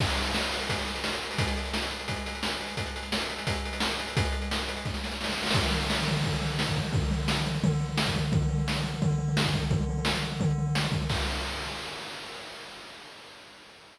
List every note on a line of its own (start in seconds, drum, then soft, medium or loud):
0.00 kick loud
0.00 crash loud
0.09 closed hi-hat medium
0.17 closed hi-hat medium
0.26 closed hi-hat medium
0.35 snare loud
0.42 closed hi-hat medium
0.52 closed hi-hat medium
0.61 closed hi-hat medium
0.69 kick medium
0.69 closed hi-hat loud
0.79 closed hi-hat medium
0.87 closed hi-hat medium
0.95 closed hi-hat medium
1.04 snare loud
1.13 closed hi-hat medium
1.22 closed hi-hat medium
1.31 open hi-hat medium
1.38 kick loud
1.38 closed hi-hat loud
1.48 closed hi-hat medium
1.57 closed hi-hat medium
1.65 closed hi-hat medium
1.74 snare loud
1.82 closed hi-hat medium
1.91 closed hi-hat medium
1.99 closed hi-hat medium
2.08 kick medium
2.08 closed hi-hat loud
2.16 closed hi-hat medium
2.26 closed hi-hat medium
2.35 closed hi-hat medium
2.43 snare loud
2.51 closed hi-hat medium
2.60 closed hi-hat medium
2.68 open hi-hat medium
2.77 kick medium
2.77 closed hi-hat loud
2.86 closed hi-hat medium
2.96 closed hi-hat medium
3.03 closed hi-hat medium
3.12 snare loud
3.20 closed hi-hat medium
3.30 closed hi-hat medium
3.38 closed hi-hat medium
3.47 kick loud
3.47 closed hi-hat loud
3.55 closed hi-hat medium
3.65 closed hi-hat medium
3.73 closed hi-hat medium
3.80 snare loud
3.91 closed hi-hat medium
3.99 closed hi-hat medium
4.07 open hi-hat medium
4.17 kick loud
4.17 closed hi-hat loud
4.25 closed hi-hat medium
4.32 closed hi-hat medium
4.42 closed hi-hat medium
4.51 snare loud
4.59 closed hi-hat medium
4.68 closed hi-hat medium
4.76 closed hi-hat medium
4.85 kick loud
4.85 snare medium
4.94 snare medium
5.04 snare medium
5.11 snare medium
5.21 snare medium
5.24 snare loud
5.30 snare medium
5.33 snare medium
5.38 snare medium
5.43 snare medium
5.46 snare loud
5.51 kick loud
5.51 snare loud
5.51 crash loud
5.64 floor tom medium
5.71 floor tom loud
5.81 floor tom medium
5.90 snare loud
5.99 floor tom medium
6.08 floor tom loud
6.17 floor tom medium
6.24 kick loud
6.24 floor tom loud
6.33 floor tom medium
6.42 floor tom medium
6.50 floor tom medium
6.59 snare loud
6.67 kick medium
6.67 floor tom medium
6.76 kick loud
6.76 floor tom medium
6.85 floor tom medium
6.92 kick loud
6.92 floor tom loud
7.03 floor tom medium
7.11 floor tom loud
7.20 floor tom medium
7.28 snare loud
7.37 floor tom medium
7.46 floor tom loud
7.55 floor tom medium
7.64 kick loud
7.64 floor tom loud
7.72 floor tom medium
7.80 floor tom medium
7.89 floor tom medium
7.97 snare loud
8.06 kick loud
8.06 floor tom medium
8.15 kick medium
8.15 floor tom loud
8.24 floor tom medium
8.32 kick loud
8.32 floor tom loud
8.42 floor tom medium
8.49 floor tom loud
8.58 floor tom medium
8.68 snare loud
8.75 floor tom medium
8.84 floor tom medium
8.94 floor tom medium
9.02 kick loud
9.02 floor tom loud
9.10 floor tom medium
9.18 floor tom medium
9.28 floor tom medium
9.37 snare loud
9.45 kick medium
9.45 floor tom medium
9.54 kick loud
9.54 floor tom loud
9.63 floor tom medium
9.71 kick loud
9.71 floor tom loud
9.81 floor tom medium
9.89 floor tom loud
9.98 floor tom medium
10.05 snare loud
10.13 floor tom medium
10.23 floor tom medium
10.32 floor tom medium
10.40 kick loud
10.40 floor tom loud
10.49 floor tom medium
10.58 floor tom medium
10.67 floor tom medium
10.75 snare loud
10.84 floor tom medium
10.92 kick loud
10.92 floor tom medium
11.02 floor tom medium
11.10 kick loud
11.10 crash loud